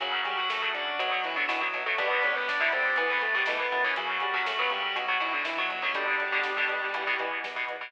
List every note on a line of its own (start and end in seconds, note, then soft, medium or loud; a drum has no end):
0.00 0.21 F#2 loud
0.00 0.40 C#3 loud
0.00 0.24 F#3 medium
0.00 0.40 F#3 medium
0.00 0.98 C#4 medium
0.00 0.24 F#4 medium
0.00 0.98 F#4 medium
0.00 1.33 F#4 loud
0.00 kick loud
0.00 closed hi-hat loud
0.13 kick medium
0.25 0.46 F#2 medium
0.25 0.37 G3 medium
0.25 0.37 G4 medium
0.25 kick medium
0.25 closed hi-hat medium
0.37 0.49 F#3 medium
0.37 0.49 F#4 medium
0.37 kick medium
0.49 0.71 F#2 medium
0.49 0.61 A3 medium
0.49 0.61 A4 medium
0.49 kick medium
0.49 snare loud
0.62 0.92 C#3 medium
0.62 0.92 F#3 medium
0.62 0.74 A3 medium
0.62 0.74 A4 medium
0.62 kick loud
0.73 0.96 F#2 medium
0.73 0.95 D4 medium
0.73 0.95 D5 medium
0.73 kick medium
0.73 closed hi-hat medium
0.88 kick medium
0.98 1.21 B1 loud
0.98 1.29 B2 medium
0.98 1.11 F#3 medium
0.98 1.29 F#3 medium
0.98 1.97 B3 medium
0.98 1.11 F#4 medium
0.98 1.98 F#4 medium
0.98 kick medium
0.98 closed hi-hat loud
1.11 1.23 F#3 medium
1.11 1.23 F#4 medium
1.11 kick medium
1.23 1.45 B1 medium
1.23 1.36 E3 medium
1.23 1.36 E4 medium
1.23 kick medium
1.23 closed hi-hat medium
1.36 1.46 B2 medium
1.36 1.48 D3 medium
1.36 1.46 F#3 medium
1.36 1.48 D4 medium
1.36 kick medium
1.48 1.70 B1 loud
1.48 1.68 B2 medium
1.48 1.61 E3 medium
1.48 1.68 F#3 medium
1.48 1.89 E4 medium
1.48 1.61 E4 medium
1.48 kick medium
1.48 snare loud
1.61 1.84 F#3 medium
1.61 1.84 F#4 medium
1.61 kick medium
1.73 1.95 B1 medium
1.73 1.84 B2 medium
1.73 1.84 F#3 medium
1.73 kick medium
1.73 closed hi-hat medium
1.86 1.96 B2 medium
1.86 1.96 F#3 medium
1.86 1.98 A3 medium
1.86 1.98 A4 medium
1.86 kick medium
1.98 2.19 G1 loud
1.98 2.38 B2 medium
1.98 2.38 D3 medium
1.98 2.38 G3 medium
1.98 2.96 B3 medium
1.98 2.21 B3 medium
1.98 2.32 B3 medium
1.98 2.96 D4 medium
1.98 2.96 G4 medium
1.98 2.21 B4 medium
1.98 kick loud
1.98 closed hi-hat loud
2.11 kick medium
2.23 2.44 G1 medium
2.23 2.35 C#4 medium
2.23 2.35 C#5 medium
2.23 kick medium
2.23 closed hi-hat medium
2.35 2.70 G3 medium
2.35 2.47 B3 medium
2.35 2.47 B4 medium
2.35 kick medium
2.48 2.69 G1 medium
2.48 2.60 D4 medium
2.48 2.60 D5 medium
2.48 kick loud
2.48 snare loud
2.60 2.90 B2 medium
2.60 2.90 D3 medium
2.60 2.90 G3 medium
2.60 2.72 E4 medium
2.60 2.72 E5 medium
2.60 kick medium
2.72 2.94 G1 medium
2.72 3.83 A3 medium
2.72 2.93 C4 medium
2.72 2.93 C5 medium
2.72 kick medium
2.72 closed hi-hat medium
2.85 kick medium
2.96 3.18 E2 loud
2.96 3.27 B2 medium
2.96 3.27 E3 medium
2.96 3.09 B3 medium
2.96 3.96 B3 medium
2.96 3.96 E4 medium
2.96 3.09 B4 medium
2.96 kick medium
2.96 closed hi-hat medium
3.10 3.22 B3 medium
3.10 3.22 B4 medium
3.10 kick medium
3.21 3.43 E2 medium
3.21 3.34 A3 medium
3.21 3.34 A4 medium
3.21 kick medium
3.21 closed hi-hat medium
3.34 3.44 B2 medium
3.34 3.44 E3 medium
3.34 3.46 G3 medium
3.34 3.46 G4 medium
3.34 kick medium
3.46 3.68 E2 loud
3.46 3.67 B2 medium
3.46 3.67 E3 medium
3.46 3.59 A3 medium
3.46 3.59 A4 medium
3.46 kick medium
3.46 snare loud
3.60 3.80 B3 medium
3.60 3.80 B4 medium
3.60 kick medium
3.72 4.18 F#2 loud
3.72 3.82 B2 medium
3.72 3.82 E3 medium
3.72 kick medium
3.72 closed hi-hat medium
3.84 3.94 B2 medium
3.84 3.94 E3 medium
3.84 3.96 C#4 medium
3.84 3.96 C#5 medium
3.84 kick medium
3.96 4.27 C#3 medium
3.96 4.17 F#3 medium
3.96 4.27 F#3 medium
3.96 4.95 C#4 medium
3.96 5.32 F#4 medium
3.96 4.95 F#4 medium
3.96 4.17 F#4 medium
3.96 kick loud
3.96 closed hi-hat loud
4.09 kick medium
4.20 4.42 F#2 medium
4.20 4.33 G3 medium
4.20 4.33 G4 medium
4.20 kick medium
4.20 closed hi-hat medium
4.34 4.53 C#3 medium
4.34 4.53 F#3 medium
4.34 4.46 F#3 medium
4.34 4.46 F#4 medium
4.34 kick loud
4.46 4.68 F#2 medium
4.46 4.58 A3 medium
4.46 4.58 A4 medium
4.46 kick loud
4.46 snare loud
4.59 4.88 C#3 medium
4.59 4.88 F#3 medium
4.59 4.70 B3 medium
4.59 4.70 B4 medium
4.59 kick medium
4.70 4.92 F#2 medium
4.70 4.93 G3 medium
4.70 4.93 G4 medium
4.70 kick medium
4.70 closed hi-hat medium
4.82 kick medium
4.95 5.17 B1 loud
4.95 5.06 B2 medium
4.95 5.06 F#3 medium
4.95 5.08 F#3 medium
4.95 5.93 B3 medium
4.95 5.93 F#4 medium
4.95 5.08 F#4 medium
4.95 kick medium
4.95 closed hi-hat loud
5.08 5.18 B2 medium
5.08 5.18 F#3 medium
5.08 5.20 F#3 medium
5.08 5.20 F#4 medium
5.08 kick medium
5.19 5.42 B1 medium
5.19 5.50 B2 medium
5.19 5.32 E3 medium
5.19 5.50 F#3 medium
5.19 5.32 E4 medium
5.19 kick medium
5.19 closed hi-hat medium
5.33 5.45 D3 medium
5.33 5.45 D4 medium
5.33 kick medium
5.45 5.66 B1 medium
5.45 5.57 E3 medium
5.45 5.92 E4 medium
5.45 5.57 E4 medium
5.45 kick medium
5.45 snare loud
5.57 5.78 B2 medium
5.57 5.81 F#3 medium
5.57 5.78 F#3 medium
5.57 5.81 F#4 medium
5.57 kick medium
5.69 6.16 G1 loud
5.69 kick medium
5.69 closed hi-hat medium
5.82 5.92 B2 medium
5.82 5.92 F#3 medium
5.82 5.94 C#4 medium
5.82 5.94 C#5 medium
5.82 kick medium
5.94 6.25 B2 medium
5.94 6.25 D3 medium
5.94 6.25 G3 medium
5.94 7.18 G3 medium
5.94 6.40 G3 medium
5.94 6.93 B3 medium
5.94 6.93 D4 medium
5.94 6.93 G4 medium
5.94 7.18 G4 medium
5.94 kick loud
5.94 closed hi-hat loud
6.07 kick medium
6.20 6.41 G1 medium
6.20 kick medium
6.20 closed hi-hat medium
6.32 6.52 B2 medium
6.32 6.52 D3 medium
6.32 6.52 G3 medium
6.32 kick medium
6.43 6.66 G1 medium
6.43 kick medium
6.43 snare loud
6.57 6.87 B2 medium
6.57 6.87 D3 medium
6.57 6.87 G3 medium
6.57 kick medium
6.69 6.90 G1 medium
6.69 kick medium
6.69 closed hi-hat medium
6.83 kick medium
6.94 7.16 E2 loud
6.94 7.04 B2 medium
6.94 7.04 E3 medium
6.94 7.92 B3 medium
6.94 7.92 E4 medium
6.94 kick medium
6.94 closed hi-hat loud
7.07 7.17 B2 medium
7.07 7.17 E3 medium
7.07 kick medium
7.19 7.40 E2 medium
7.19 7.49 B2 medium
7.19 7.49 E3 medium
7.19 kick medium
7.19 closed hi-hat medium
7.31 kick medium
7.44 7.65 E2 medium
7.44 kick medium
7.44 snare loud
7.56 7.76 B2 medium
7.56 7.76 E3 medium
7.56 kick medium
7.68 7.90 E2 medium
7.68 kick medium
7.68 closed hi-hat medium
7.81 7.91 B2 medium
7.81 7.91 E3 medium
7.81 kick medium